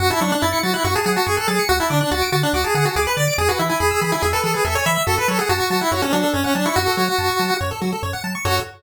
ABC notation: X:1
M:4/4
L:1/16
Q:1/4=142
K:F#m
V:1 name="Lead 1 (square)"
F E D D E2 F E F G G F G A G2 | F E D D F2 F D F G G F G B d2 | G F E E G2 G E G A A G A c e2 | A B A G F2 F E F C D2 C C D E |
F8 z8 | F4 z12 |]
V:2 name="Lead 1 (square)"
f a c' f' a' c'' a' f' c' a f a c' f' a' c'' | f a d' f' a' d'' a' f' d' a f a d' f' a' d'' | G B e g b e' b g e B G B e g b e' | F A c f a c' a f c A F A c f a c' |
F A c f a c' a f c A F A c f a c' | [FAc]4 z12 |]
V:3 name="Synth Bass 1" clef=bass
F,,2 F,2 F,,2 F,2 F,,2 F,2 F,,2 F,2 | D,,2 D,2 D,,2 D,2 D,,2 D,2 D,,2 D,2 | E,,2 E,2 E,,2 E,2 E,,2 E,2 E,,2 E,2 | F,,2 F,2 F,,2 F,2 F,,2 F,2 F,,2 F,2 |
F,,2 F,2 F,,2 F,2 F,,2 F,2 F,,2 F,2 | F,,4 z12 |]